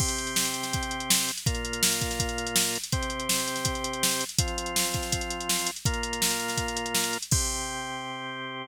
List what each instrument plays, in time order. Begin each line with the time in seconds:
0.00 drawbar organ C3 C4 G4, kick, crash
0.08 closed hi-hat
0.18 closed hi-hat
0.27 closed hi-hat
0.36 snare
0.45 closed hi-hat
0.54 closed hi-hat
0.63 snare, closed hi-hat
0.73 kick, closed hi-hat
0.83 closed hi-hat
0.91 closed hi-hat
1.00 closed hi-hat
1.10 snare
1.19 closed hi-hat
1.29 closed hi-hat
1.38 closed hi-hat
1.46 drawbar organ A#2 A#3 F4, kick, closed hi-hat
1.55 closed hi-hat
1.65 closed hi-hat
1.73 closed hi-hat
1.83 snare
1.92 closed hi-hat
2.01 kick, closed hi-hat
2.11 snare, closed hi-hat
2.20 kick, closed hi-hat
2.29 closed hi-hat
2.38 closed hi-hat
2.47 closed hi-hat
2.56 snare
2.65 closed hi-hat
2.75 closed hi-hat
2.84 closed hi-hat
2.92 drawbar organ C3 C4 G4, kick, closed hi-hat
3.03 closed hi-hat
3.10 closed hi-hat
3.20 closed hi-hat
3.29 snare
3.39 closed hi-hat
3.48 closed hi-hat
3.56 snare, closed hi-hat
3.65 kick, closed hi-hat
3.75 closed hi-hat
3.84 closed hi-hat
3.93 closed hi-hat
4.03 snare
4.12 closed hi-hat
4.21 closed hi-hat
4.29 closed hi-hat
4.38 drawbar organ F3 C4 F4, kick, closed hi-hat
4.48 closed hi-hat
4.58 closed hi-hat
4.66 closed hi-hat
4.76 snare
4.85 closed hi-hat
4.94 kick, closed hi-hat
5.03 snare, closed hi-hat
5.12 kick, closed hi-hat
5.21 closed hi-hat
5.30 closed hi-hat
5.40 closed hi-hat
5.49 snare
5.59 closed hi-hat
5.67 closed hi-hat
5.76 closed hi-hat
5.85 drawbar organ A#2 A#3 F4, kick, closed hi-hat
5.94 closed hi-hat
6.03 closed hi-hat
6.13 closed hi-hat
6.22 snare
6.30 closed hi-hat
6.40 closed hi-hat
6.48 snare, closed hi-hat
6.57 kick, closed hi-hat
6.68 closed hi-hat
6.77 closed hi-hat
6.86 closed hi-hat
6.95 snare
7.04 closed hi-hat
7.13 closed hi-hat
7.22 closed hi-hat
7.31 drawbar organ C3 C4 G4, kick, crash